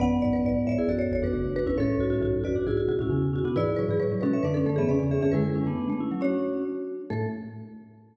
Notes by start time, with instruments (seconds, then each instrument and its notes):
0.00 xylophone A1 F#2, marimba B3 F#5, vibraphone B4 D5
0.22 xylophone B1 G#2, marimba D5
0.33 xylophone A1 F#2, marimba B4
0.44 xylophone B1 G#2, marimba D5
0.54 xylophone B1 G#2
0.65 xylophone C#2 A2, vibraphone C#5 E5, marimba D5
0.78 vibraphone E4 G#4
0.87 xylophone A1 F#2, vibraphone F#4 A4, marimba D5
0.99 marimba C#5
1.12 xylophone G#1 E2, marimba C#5
1.22 xylophone A1 F#2, vibraphone D4 F#4, marimba B4
1.33 xylophone F#1 D2, vibraphone D4 F#4
1.44 xylophone F#1 D2
1.56 vibraphone D4 F#4, marimba B4
1.66 xylophone G#1 E2, vibraphone C#4 E4, marimba B4
1.77 xylophone C#2 A2, marimba C#4 A4, vibraphone A4 C#5
1.99 xylophone B1 G#2, marimba F#4
2.10 xylophone C#2 A2, marimba F#4
2.21 xylophone B1 G#2, marimba F#4
2.33 xylophone B1 G#2
2.44 xylophone A1 F#2, marimba F#4, vibraphone B4 D5
2.56 vibraphone D4 F#4
2.67 xylophone B1 G#2, vibraphone E4 G#4, marimba F#4
2.77 marimba F#4
2.88 xylophone D2 B2, marimba F#4
2.98 xylophone C#2 A2, vibraphone C#4 E4, marimba F#4
3.10 xylophone E2 C#3, vibraphone C#4 E4
3.22 xylophone E2 C#3
3.33 vibraphone C#4 E4, marimba F#4
3.44 xylophone D2 B2, vibraphone B3 D4, marimba F#4
3.56 xylophone G#2 E3, marimba E4 D5, vibraphone G#4 B4
3.76 xylophone A2 F#3, marimba B4
3.89 xylophone G#2 E3, marimba G#4
4.00 xylophone A2 F#3, marimba B4
4.12 xylophone A2 F#3
4.21 xylophone B2 G#3, marimba C#4 B4, vibraphone F#4 A4
4.33 vibraphone C#5 E5
4.43 xylophone F#2 D3, marimba D4 B4, vibraphone B4 D5
4.54 marimba C#4 A4
4.66 xylophone F#2 D3, marimba A3 A4
4.76 xylophone G#2 E3, marimba B3 G#4, vibraphone C#5 E5
4.87 xylophone E2 C#3, marimba C#4, vibraphone B4 D5
5.00 xylophone E2 C#3, marimba C#4
5.11 marimba G#4, vibraphone C#5 E5
5.21 xylophone F#2 D3, marimba C#4 G#4, vibraphone C#5 E5
5.32 xylophone F#2 D3, marimba G#3 B4, vibraphone E4 G#4
5.44 marimba G#3, vibraphone E4 G#4
5.55 vibraphone C#4 E4
5.67 marimba A3, vibraphone B3 D4
5.78 vibraphone B3 D4
5.89 marimba A3, vibraphone B3 D4
6.00 vibraphone C#4 E4
6.11 marimba F#3, vibraphone C#4 E4
6.21 marimba C#4 C#5, vibraphone D4 F#4
7.10 xylophone A2, marimba A3 A4, vibraphone A4